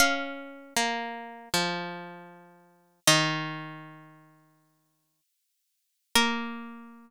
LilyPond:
<<
  \new Staff \with { instrumentName = "Pizzicato Strings" } { \time 4/4 \key bes \minor \tempo 4 = 78 f''1 | ees''4. r2 r8 | bes'1 | }
  \new Staff \with { instrumentName = "Pizzicato Strings" } { \time 4/4 \key bes \minor des'4 bes4 f2 | ees2. r4 | bes1 | }
>>